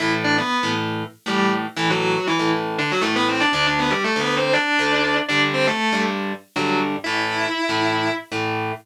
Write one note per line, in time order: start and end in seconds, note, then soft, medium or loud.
0.00 0.40 A2 medium
0.00 0.40 E3 medium
0.00 0.40 A3 medium
0.00 0.11 E4 medium
0.00 0.11 E5 medium
0.24 0.36 D4 medium
0.24 0.36 D5 medium
0.38 0.69 B3 medium
0.38 0.69 B4 medium
0.63 1.03 A2 medium
0.63 1.03 E3 medium
0.63 1.03 A3 medium
1.26 1.66 A2 medium
1.26 1.66 E3 medium
1.26 1.52 G3 medium
1.26 1.66 A3 medium
1.26 1.52 G4 medium
1.76 2.17 A2 medium
1.76 2.17 E3 loud
1.76 1.89 E3 medium
1.76 2.17 A3 loud
1.76 1.89 E4 medium
1.90 2.26 F#3 medium
1.90 2.26 F#4 medium
2.27 2.49 E3 medium
2.27 2.49 E4 medium
2.39 2.80 A2 medium
2.39 2.80 E3 medium
2.39 2.80 A3 medium
2.78 2.90 D3 medium
2.78 2.90 D4 medium
2.91 3.03 F#3 medium
2.91 3.03 F#4 medium
3.01 3.43 A2 medium
3.01 3.43 E3 medium
3.01 3.13 A3 medium
3.01 3.43 A3 medium
3.01 3.13 A4 medium
3.16 3.28 B3 medium
3.16 3.28 B4 medium
3.29 3.41 C4 medium
3.29 3.41 C5 medium
3.40 3.52 D4 medium
3.40 3.52 D5 medium
3.53 3.93 D2 medium
3.53 3.93 D3 loud
3.53 3.93 A3 medium
3.53 3.66 D4 medium
3.53 3.66 D5 medium
3.67 3.79 D4 medium
3.67 3.79 D5 medium
3.79 3.91 B3 medium
3.79 3.91 B4 medium
3.90 4.02 G3 medium
3.90 4.02 G4 medium
4.04 4.20 A3 medium
4.04 4.20 A4 medium
4.16 4.56 D2 medium
4.16 4.56 D3 medium
4.16 4.56 A3 medium
4.16 4.36 B3 medium
4.16 4.36 B4 medium
4.37 4.53 C4 medium
4.37 4.53 C5 medium
4.53 5.17 D4 medium
4.53 5.17 D5 medium
4.79 5.19 D2 medium
4.79 5.19 D3 medium
4.79 5.19 A3 medium
5.28 5.70 G2 medium
5.28 5.70 D3 loud
5.28 5.70 G3 medium
5.28 5.40 D4 medium
5.28 5.40 D5 loud
5.54 5.66 C4 medium
5.54 5.66 C5 medium
5.67 6.01 A3 medium
5.67 6.01 A4 medium
5.92 6.33 G2 medium
5.92 6.33 D3 medium
5.92 6.33 G3 medium
6.56 6.96 G2 medium
6.56 6.96 D3 medium
6.56 6.80 F#3 medium
6.56 6.96 G3 medium
6.56 6.80 F#4 medium
7.04 7.46 A2 medium
7.04 7.46 E3 loud
7.04 7.46 A3 medium
7.04 8.12 E4 medium
7.04 8.12 E5 medium
7.69 8.09 A2 medium
7.69 8.09 E3 medium
7.69 8.09 A3 medium
8.32 8.72 A2 medium
8.32 8.72 E3 medium
8.32 8.72 A3 medium